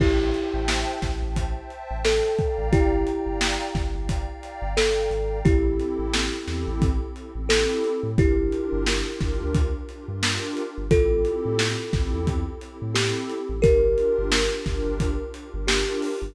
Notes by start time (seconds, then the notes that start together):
0.00 A1 E4 G4 C5 E5 G5 A5, kick, crash
0.19 C5 E5 G5 A5
0.34 C5 E5 G5 A5, closed hi-hat
0.54 A1
0.68 snare
1.02 A1, kick, snare, closed hi-hat
1.21 A1 C5 E5 G5 A5
1.36 kick, closed hi-hat
1.57 C5 E5 G5 A5
1.70 closed hi-hat
1.91 A1
2.05 A4 C5 E5 G5 A5, snare
2.38 D5 F5 G5 A#5, kick, closed hi-hat
2.58 A1
2.72 G1 E4 G4, kick, closed hi-hat
2.92 D5 F5 G5 A#5
3.06 D5 F5 G5 A#5, closed hi-hat
3.26 G1
3.41 snare
3.75 G1, kick, snare, closed hi-hat
3.94 G1 D5 F5 G5 A#5
4.09 kick, closed hi-hat
4.28 D5 F5 G5 A#5
4.43 closed hi-hat
4.62 G1
4.77 G1 A4 D5 F5 G5 A#5, snare
5.11 G#1 D5 F5 G5 A#5, closed hi-hat
5.45 A1 C4 E4 G4 A4, kick, closed hi-hat
5.65 C4 E4 G4 A4
5.80 closed hi-hat
5.99 A1
6.13 snare
6.33 C4 E4 G4 A4
6.48 E2, snare, closed hi-hat
6.67 A1
6.82 kick, closed hi-hat
7.15 C4 E4 G4 A4, closed hi-hat
7.35 A1 C4 E4 G4 A4
7.49 A4, snare
7.84 closed hi-hat
8.03 A2
8.17 G1 D4 E4 F4 G4 A#4, kick, closed hi-hat
8.37 D4 F4 G4 A#4
8.52 closed hi-hat
8.72 G1
8.86 snare
9.06 D4 F4 G4 A#4
9.20 G1, kick, snare, closed hi-hat
9.41 D2
9.55 kick, closed hi-hat
9.89 D4 F4 G4 A#4, closed hi-hat
10.08 G2 D4 F4 G4 A#4
10.23 snare
10.57 closed hi-hat
10.78 G1
10.90 A1 C4 E4 F4 G4 A4, kick, closed hi-hat
11.11 C4 E4 G4 A4
11.25 closed hi-hat
11.45 A2
11.59 snare
11.80 C4 E4 G4 A4
11.93 A1, kick, snare, closed hi-hat
12.13 E2
12.27 kick, closed hi-hat
12.61 C4 E4 G4 A4, closed hi-hat
12.80 A2 C4 E4 G4 A4
12.95 G4, snare
13.30 closed hi-hat
13.49 A1
13.62 G1 D4 F4 G4 A#4, kick, closed hi-hat
13.83 D4 F4 G4 A#4
13.98 closed hi-hat
14.18 G1
14.32 snare
14.53 D4 F4 G4 A#4
14.66 G1, kick, snare, closed hi-hat
14.86 G1
15.00 kick, closed hi-hat
15.34 D4 F4 G4 A#4, closed hi-hat
15.54 G1 D4 F4 G4 A#4
15.67 G4, snare
16.02 open hi-hat
16.22 G1